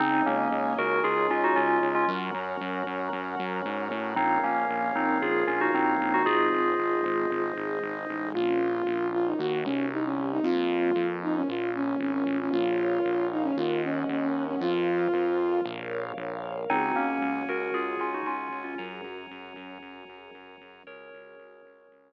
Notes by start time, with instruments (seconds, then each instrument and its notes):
0.00 synth bass 1 C#2, tubular bells C4 D#4, drawbar organ C#4 D#4 G#4, string ensemble 1 C#5 D#5 G#5
0.26 synth bass 1 C#2, tubular bells A#3 C#4
0.52 synth bass 1 C#2
0.78 synth bass 1 C#2, tubular bells F#4 A#4
1.04 synth bass 1 C#2, tubular bells F4 G#4
1.30 synth bass 1 C#2, tubular bells C#4 F4
1.44 tubular bells D#4 F#4
1.56 synth bass 1 C#2, tubular bells C#4 F4
1.83 synth bass 1 C#2
1.95 tubular bells C#4 F4
2.08 synth bass 1 F#2, drawbar organ C#4 F#4 A#4, string ensemble 1 C#5 F#5 A#5
2.34 synth bass 1 F#2
2.61 synth bass 1 F#2
2.87 synth bass 1 F#2
3.13 synth bass 1 F#2
3.39 synth bass 1 F#2
3.65 synth bass 1 G#2
3.91 synth bass 1 A2
4.16 synth bass 1 A#1, string ensemble 1 A#3 C#4 F4, tubular bells C4 D#4, drawbar organ A#4 C#5 F5
4.44 synth bass 1 A#1, tubular bells A#3 C#4
4.70 synth bass 1 A#1
4.96 synth bass 1 A#1, tubular bells C4 D#4
5.22 synth bass 1 A#1, string ensemble 1 F3 A#3 F4, tubular bells F4 G#4
5.47 synth bass 1 A#1, tubular bells C#4 F4
5.61 tubular bells D#4 F#4
5.74 synth bass 1 A#1, tubular bells C4 D#4
6.00 synth bass 1 A#1
6.14 tubular bells D#4 F#4
6.25 synth bass 1 G#1, string ensemble 1 G#3 C4 D#4, tubular bells F4 G#4, drawbar organ G#4 C5 D#5
6.53 synth bass 1 G#1
6.79 synth bass 1 G#1
7.04 synth bass 1 G#1
7.30 synth bass 1 G#1, string ensemble 1 G#3 D#4 G#4
7.57 synth bass 1 G#1
7.82 synth bass 1 G#1
8.09 synth bass 1 A1
8.34 synth bass 1 A#1, string ensemble 1 A#3 C#4 F4, ocarina F4
8.87 synth bass 1 A#1
9.13 ocarina F4
9.26 ocarina D#4
9.38 synth bass 1 D#2, string ensemble 1 A#3 D#4 F#4, ocarina F#4
9.64 synth bass 1 C2, ocarina C#4
9.91 string ensemble 1 C4 E4 G4, ocarina D#4
10.05 ocarina C#4
10.32 ocarina D#4
10.43 synth bass 1 F2, string ensemble 1 A#3 C4 F4, ocarina F4
10.96 synth bass 1 F2
11.23 ocarina D#4
11.35 ocarina C#4
11.48 synth bass 1 A#1, string ensemble 1 A#3 C#4 F4, ocarina F4
11.75 ocarina C#4
12.00 synth bass 1 G#1, ocarina C#4
12.12 ocarina C#4
12.26 synth bass 1 A1
12.40 ocarina C#4
12.51 synth bass 1 A#1, ocarina F4, string ensemble 1 A#4 C#5 F5
13.05 synth bass 1 A#1
13.32 ocarina D#4
13.43 ocarina C#4
13.56 synth bass 1 D#2, ocarina F4, string ensemble 1 A#4 D#5 F#5
13.83 ocarina C#4
14.09 synth bass 1 D#2, ocarina C#4
14.22 ocarina C#4
14.47 ocarina C#4
14.60 synth bass 1 F2, ocarina F4, string ensemble 1 A#4 C5 F5
15.14 synth bass 1 F2
15.65 synth bass 1 A#1, string ensemble 1 A#4 C#5 F5
16.17 synth bass 1 A#1
16.70 synth bass 1 C#2, tubular bells C4 D#4, string ensemble 1 C#4 F#4 G#4, drawbar organ C#5 F#5 G#5
16.96 synth bass 1 C#2, tubular bells A#3 C#4
17.21 synth bass 1 C#2
17.48 synth bass 1 C#2, tubular bells F#4 A#4
17.73 synth bass 1 C#2, tubular bells F4 G#4
18.00 synth bass 1 C#2, tubular bells C#4 F4
18.14 tubular bells D#4 F#4
18.26 synth bass 1 C#2, tubular bells C#4 F4
18.52 synth bass 1 C#2
18.64 tubular bells C#4 F4
18.78 synth bass 1 F#2, string ensemble 1 C#4 F#4 G#4 A#4, drawbar organ C#5 F#5 G#5 A#5
19.04 synth bass 1 F#2
19.31 synth bass 1 F#2
19.56 synth bass 1 F#2
19.82 synth bass 1 F#2
20.09 synth bass 1 F#2
20.34 synth bass 1 F#2
20.61 synth bass 1 F#2
20.87 synth bass 1 C#2, string ensemble 1 C#4 F#4 G#4, drawbar organ C#4 F#4 G#4, tubular bells A#4 C#5
21.13 synth bass 1 C#2
21.39 synth bass 1 C#2
21.65 synth bass 1 C#2
21.91 synth bass 1 C#2